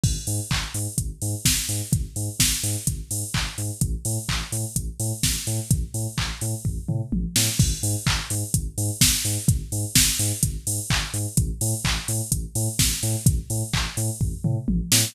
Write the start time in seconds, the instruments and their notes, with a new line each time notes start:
0.03 synth bass 2 G#1, kick, crash
0.27 synth bass 2 G#2, open hi-hat
0.51 synth bass 2 G#1, kick, clap
0.74 synth bass 2 G#2, open hi-hat
0.98 synth bass 2 G#1, kick, closed hi-hat
1.22 synth bass 2 G#2, open hi-hat
1.45 synth bass 2 G#1, kick, snare
1.69 synth bass 2 G#2, open hi-hat
1.93 synth bass 2 G#1, kick, closed hi-hat
2.16 synth bass 2 G#2, open hi-hat
2.40 synth bass 2 G#1, kick, snare
2.63 synth bass 2 G#2, open hi-hat
2.87 synth bass 2 G#1, kick, closed hi-hat
3.11 synth bass 2 G#2, open hi-hat
3.34 synth bass 2 G#1, kick, clap
3.58 synth bass 2 G#2, open hi-hat
3.81 synth bass 2 A1, kick, closed hi-hat
4.05 synth bass 2 A2, open hi-hat
4.29 synth bass 2 A1, kick, clap
4.52 synth bass 2 A2, open hi-hat
4.76 synth bass 2 A1, kick, closed hi-hat
5.00 synth bass 2 A2, open hi-hat
5.23 synth bass 2 A1, kick, snare
5.47 synth bass 2 A2, open hi-hat
5.71 synth bass 2 A1, kick, closed hi-hat
5.94 synth bass 2 A2, open hi-hat
6.18 synth bass 2 A1, kick, clap
6.41 synth bass 2 A2, open hi-hat
6.65 synth bass 2 A1, kick, floor tom
6.88 synth bass 2 A2, mid tom
7.12 synth bass 2 A1, high tom
7.36 synth bass 2 A2, snare
7.59 synth bass 2 G#1, kick, crash
7.83 synth bass 2 G#2, open hi-hat
8.06 synth bass 2 G#1, kick, clap
8.30 synth bass 2 G#2, open hi-hat
8.54 synth bass 2 G#1, kick, closed hi-hat
8.78 synth bass 2 G#2, open hi-hat
9.01 synth bass 2 G#1, kick, snare
9.25 synth bass 2 G#2, open hi-hat
9.48 synth bass 2 G#1, kick, closed hi-hat
9.72 synth bass 2 G#2, open hi-hat
9.95 synth bass 2 G#1, kick, snare
10.19 synth bass 2 G#2, open hi-hat
10.43 synth bass 2 G#1, kick, closed hi-hat
10.67 synth bass 2 G#2, open hi-hat
10.90 synth bass 2 G#1, kick, clap
11.13 synth bass 2 G#2, open hi-hat
11.37 synth bass 2 A1, kick, closed hi-hat
11.61 synth bass 2 A2, open hi-hat
11.85 synth bass 2 A1, kick, clap
12.08 synth bass 2 A2, open hi-hat
12.32 synth bass 2 A1, kick, closed hi-hat
12.55 synth bass 2 A2, open hi-hat
12.79 synth bass 2 A1, kick, snare
13.03 synth bass 2 A2, open hi-hat
13.26 synth bass 2 A1, kick, closed hi-hat
13.50 synth bass 2 A2, open hi-hat
13.73 synth bass 2 A1, kick, clap
13.97 synth bass 2 A2, open hi-hat
14.21 synth bass 2 A1, kick, floor tom
14.44 synth bass 2 A2, mid tom
14.68 synth bass 2 A1, high tom
14.92 synth bass 2 A2, snare